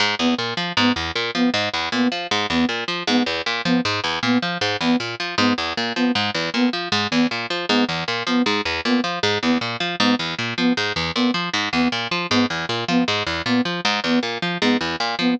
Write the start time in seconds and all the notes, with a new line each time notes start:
0.00 G#2
0.19 E2 B3
0.38 A#2
0.57 F3
0.77 G#2 B3
0.96 E2
1.15 A#2
1.35 F3 B3
1.54 G#2
1.74 E2
1.92 A#2 B3
2.12 F3
2.31 G#2
2.50 E2 B3
2.69 A#2
2.88 F3
3.07 G#2 B3
3.26 E2
3.46 A#2
3.65 F3 B3
3.85 G#2
4.04 E2
4.23 A#2 B3
4.42 F3
4.61 G#2
4.81 E2 B3
5.00 A#2
5.20 F3
5.38 G#2 B3
5.58 E2
5.77 A#2
5.96 F3 B3
6.15 G#2
6.34 E2
6.54 A#2 B3
6.73 F3
6.92 G#2
7.11 E2 B3
7.31 A#2
7.50 F3
7.69 G#2 B3
7.89 E2
8.08 A#2
8.27 F3 B3
8.46 G#2
8.65 E2
8.85 A#2 B3
9.04 F3
9.23 G#2
9.42 E2 B3
9.61 A#2
9.80 F3
10.00 G#2 B3
10.19 E2
10.39 A#2
10.58 F3 B3
10.77 G#2
10.96 E2
11.16 A#2 B3
11.34 F3
11.54 G#2
11.73 E2 B3
11.92 A#2
12.11 F3
12.30 G#2 B3
12.50 E2
12.69 A#2
12.88 F3 B3
13.08 G#2
13.27 E2
13.46 A#2 B3
13.65 F3
13.85 G#2
14.04 E2 B3
14.23 A#2
14.42 F3
14.62 G#2 B3
14.81 E2
15.00 A#2
15.19 F3 B3